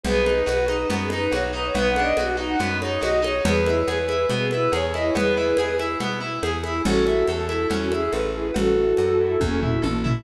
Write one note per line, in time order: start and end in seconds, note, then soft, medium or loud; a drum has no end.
0.04 0.43 B1 medium
0.04 0.24 B3 medium
0.04 0.39 G#4 medium
0.04 0.39 B4 medium
0.04 cowbell loud
0.04 low conga loud
0.26 0.45 D#4 medium
0.26 high conga medium
0.46 0.85 B1 medium
0.46 0.65 F#4 medium
0.46 0.84 B4 medium
0.46 cowbell medium
0.46 high conga medium
0.68 0.88 D#4 medium
0.68 high conga medium
0.90 1.28 F#2 medium
0.90 1.09 B3 medium
0.90 cowbell medium
0.90 low conga loud
1.02 1.13 G#4 medium
1.10 1.31 D#4 medium
1.10 1.32 B4 medium
1.10 high conga medium
1.31 1.71 B1 medium
1.31 1.52 F#4 medium
1.31 1.43 C#5 medium
1.31 cowbell loud
1.31 high conga medium
1.52 1.72 D#4 medium
1.52 1.62 B4 medium
1.65 1.75 C#5 medium
1.74 2.13 B1 medium
1.74 1.93 B3 medium
1.74 1.89 B4 medium
1.74 cowbell loud
1.74 low conga loud
1.89 2.02 F#5 medium
1.96 2.17 D4 medium
1.96 high conga medium
2.01 2.15 D#5 medium
2.17 2.56 B1 medium
2.17 2.37 F#4 medium
2.17 cowbell medium
2.17 high conga loud
2.37 2.56 D#4 medium
2.49 2.59 F#5 medium
2.59 2.98 F#2 medium
2.59 2.78 B3 medium
2.59 cowbell medium
2.59 low conga medium
2.81 3.01 D#4 medium
2.81 2.99 C#5 medium
2.81 high conga medium
3.01 3.41 B1 medium
3.01 3.20 F#4 medium
3.01 3.19 D#5 medium
3.01 cowbell medium
3.01 high conga loud
3.22 3.41 D#4 medium
3.22 3.42 C#5 medium
3.22 high conga medium
3.45 3.83 E2 loud
3.45 3.64 B3 medium
3.45 3.80 G#4 medium
3.45 3.80 B4 medium
3.45 cowbell loud
3.45 low conga loud
3.66 3.85 E4 medium
3.66 high conga medium
3.88 4.26 E2 medium
3.88 4.07 G#4 medium
3.88 4.26 B4 medium
3.88 cowbell medium
3.88 high conga medium
4.08 4.27 E4 medium
4.08 high conga medium
4.30 4.68 B2 medium
4.30 4.49 B3 medium
4.30 cowbell loud
4.30 low conga medium
4.39 4.49 G#4 medium
4.50 4.71 E4 medium
4.50 4.68 B4 medium
4.50 high conga medium
4.72 5.11 E2 medium
4.72 4.92 G#4 medium
4.72 4.85 C#5 medium
4.72 cowbell loud
4.72 high conga loud
4.94 5.14 E4 medium
4.94 5.04 D#5 medium
4.94 high conga medium
5.05 5.15 C#5 medium
5.15 5.54 E2 medium
5.15 5.35 B3 medium
5.15 5.71 G#4 medium
5.15 5.71 B4 medium
5.15 cowbell loud
5.15 low conga loud
5.37 5.56 E4 medium
5.57 5.96 E2 medium
5.57 5.77 G#4 medium
5.57 cowbell medium
5.57 high conga loud
5.79 5.98 E4 medium
5.79 high conga medium
6.00 6.39 B2 medium
6.00 6.19 B3 medium
6.00 cowbell medium
6.00 low conga medium
6.20 6.40 E4 medium
6.43 6.81 E2 medium
6.43 6.62 G#4 medium
6.43 cowbell medium
6.43 high conga loud
6.63 6.83 E4 medium
6.63 high conga medium
6.85 7.24 A1 loud
6.85 7.05 C#4 medium
6.85 7.26 F#4 medium
6.85 7.26 A4 medium
6.85 cowbell loud
6.85 low conga loud
7.07 7.27 E4 medium
7.07 high conga medium
7.27 7.66 E2 medium
7.27 7.64 A4 medium
7.27 7.48 A4 medium
7.27 cowbell medium
7.27 high conga medium
7.49 7.69 E4 medium
7.49 high conga medium
7.70 8.09 E2 medium
7.70 7.89 C#4 medium
7.70 cowbell medium
7.70 low conga medium
7.81 7.91 F#4 medium
7.92 8.11 E4 medium
7.92 8.13 G#4 medium
7.92 high conga medium
8.11 8.51 A1 medium
8.11 8.31 A4 medium
8.11 8.21 B4 medium
8.11 cowbell medium
8.11 high conga medium
8.34 8.53 E4 medium
8.34 8.45 G#4 medium
8.45 8.55 B4 medium
8.54 8.94 A1 medium
8.54 8.74 C#4 medium
8.54 9.31 F#4 medium
8.54 9.31 A4 medium
8.54 cowbell loud
8.54 low conga loud
8.76 8.96 E4 medium
8.97 9.37 F#2 medium
8.97 9.18 A4 medium
8.97 cowbell medium
8.97 high conga medium
9.20 9.39 E4 medium
9.40 9.79 E2 medium
9.40 9.60 C#4 medium
9.40 kick medium
9.40 high tom medium
9.62 9.82 E4 medium
9.62 floor tom loud
9.82 10.22 A1 medium
9.82 10.01 A4 medium
9.82 high tom loud
10.04 10.23 E4 medium
10.04 floor tom loud